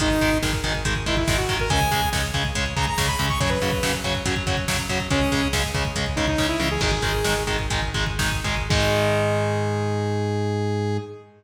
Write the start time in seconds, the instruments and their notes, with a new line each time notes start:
0.00 synth bass 1 G#1, overdriven guitar D#3 G#3, lead 2 (sawtooth) D#4, kick, closed hi-hat
0.11 kick
0.21 synth bass 1 G#1, overdriven guitar D#3 G#3, kick, closed hi-hat
0.32 kick
0.42 synth bass 1 G#1, overdriven guitar D#3 G#3, kick, snare
0.53 kick
0.64 synth bass 1 G#1, overdriven guitar D#3 G#3, kick, closed hi-hat
0.74 kick
0.85 synth bass 1 G#1, overdriven guitar D#3 G#3, kick, closed hi-hat
0.96 kick
1.06 synth bass 1 G#1, overdriven guitar D#3 G#3, lead 2 (sawtooth) E4, kick, closed hi-hat
1.17 lead 2 (sawtooth) E4, kick
1.28 synth bass 1 G#1, overdriven guitar D#3 G#3, kick, snare
1.37 lead 2 (sawtooth) F#4, kick
1.49 synth bass 1 G#1, overdriven guitar D#3 G#3, kick, closed hi-hat
1.60 lead 2 (sawtooth) A#4, kick
1.70 synth bass 1 C#2, overdriven guitar C#3 G#3, lead 2 (sawtooth) G#5, kick, closed hi-hat
1.81 kick
1.91 synth bass 1 C#2, overdriven guitar C#3 G#3, kick, closed hi-hat
2.02 kick
2.13 synth bass 1 C#2, overdriven guitar C#3 G#3, kick, snare
2.23 kick
2.34 synth bass 1 C#2, overdriven guitar C#3 G#3, kick, closed hi-hat
2.45 kick
2.55 synth bass 1 C#2, overdriven guitar C#3 G#3, kick, closed hi-hat
2.66 kick
2.76 synth bass 1 C#2, overdriven guitar C#3 G#3, lead 2 (sawtooth) A#5, kick, closed hi-hat
2.86 lead 2 (sawtooth) A#5, kick
2.98 synth bass 1 C#2, overdriven guitar C#3 G#3, kick, snare
3.08 lead 2 (sawtooth) B5, kick
3.19 synth bass 1 C#2, overdriven guitar C#3 G#3, kick, closed hi-hat
3.29 lead 2 (sawtooth) C#6, kick
3.40 synth bass 1 F#2, overdriven guitar C#3 F#3, lead 2 (sawtooth) C#5, kick, closed hi-hat
3.49 lead 2 (sawtooth) B4, kick
3.62 synth bass 1 F#2, overdriven guitar C#3 F#3, kick, closed hi-hat
3.72 kick
3.83 synth bass 1 F#2, overdriven guitar C#3 F#3, kick, snare
3.94 kick
4.04 synth bass 1 F#2, overdriven guitar C#3 F#3, kick, closed hi-hat
4.15 kick
4.25 synth bass 1 F#2, overdriven guitar C#3 F#3, kick, closed hi-hat
4.36 kick
4.47 synth bass 1 F#2, overdriven guitar C#3 F#3, kick, closed hi-hat
4.57 kick
4.68 synth bass 1 F#2, overdriven guitar C#3 F#3, kick, snare
4.79 kick
4.89 synth bass 1 F#2, overdriven guitar C#3 F#3, kick, closed hi-hat
5.00 kick
5.10 synth bass 1 C#2, overdriven guitar C#3 G#3, lead 2 (sawtooth) C#4, kick, closed hi-hat
5.21 kick
5.32 synth bass 1 C#2, overdriven guitar C#3 G#3, kick, closed hi-hat
5.43 kick
5.53 synth bass 1 C#2, overdriven guitar C#3 G#3, kick, snare
5.64 kick
5.74 synth bass 1 C#2, overdriven guitar C#3 G#3, kick, closed hi-hat
5.85 kick
5.96 synth bass 1 C#2, overdriven guitar C#3 G#3, kick, closed hi-hat
6.06 kick
6.16 synth bass 1 C#2, overdriven guitar C#3 G#3, lead 2 (sawtooth) D#4, kick, closed hi-hat
6.28 lead 2 (sawtooth) D#4, kick
6.38 synth bass 1 C#2, overdriven guitar C#3 G#3, kick, snare
6.48 lead 2 (sawtooth) E4
6.59 synth bass 1 C#2, overdriven guitar C#3 G#3, mid tom
6.71 lead 2 (sawtooth) G#4
6.81 synth bass 1 G#1, overdriven guitar D#3 G#3, lead 2 (sawtooth) G#4, kick, crash
6.91 lead 2 (sawtooth) G#4, kick
7.02 synth bass 1 G#1, overdriven guitar D#3 G#3, kick, closed hi-hat
7.13 kick
7.24 synth bass 1 G#1, overdriven guitar D#3 G#3, snare
7.36 kick
7.47 synth bass 1 G#1, overdriven guitar D#3 G#3, kick, closed hi-hat
7.59 kick
7.70 synth bass 1 G#1, overdriven guitar D#3 G#3, kick, closed hi-hat
7.82 kick
7.94 synth bass 1 G#1, overdriven guitar D#3 G#3, kick, closed hi-hat
8.06 kick
8.19 synth bass 1 G#1, overdriven guitar D#3 G#3, kick, snare
8.32 kick
8.44 synth bass 1 G#1, overdriven guitar D#3 G#3, kick, closed hi-hat
8.57 kick
8.69 synth bass 1 G#2, overdriven guitar D#3 G#3, lead 2 (sawtooth) G#4, kick, crash